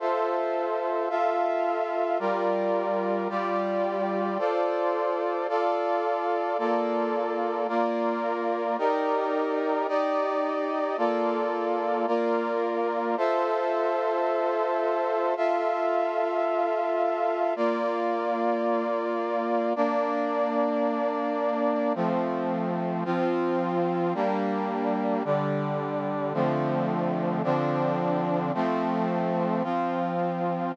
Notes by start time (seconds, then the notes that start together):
0.00 F4 A4 C5 E5
1.10 F4 A4 E5 F5
2.19 G3 F4 A#4 D5
3.29 G3 F4 G4 D5
4.39 F4 A4 C5 D5
5.49 F4 A4 D5 F5
6.58 A#3 F4 A4 D5
7.68 A#3 F4 A#4 D5
8.78 D#4 G4 A#4 D5
9.88 D#4 G4 D5 D#5
10.97 A#3 F4 A4 D5
12.07 A#3 F4 A#4 D5
13.17 F4 A4 C5 E5
15.37 F4 A4 E5 F5
17.56 A#3 F4 D5
19.76 A#3 D4 D5
21.95 F3 A3 C4
23.05 F3 C4 F4
24.14 G3 A#3 D4
25.25 D3 G3 D4
26.34 D3 F3 A3 C4
27.44 D3 F3 C4 D4
28.54 F3 A3 C4
29.63 F3 C4 F4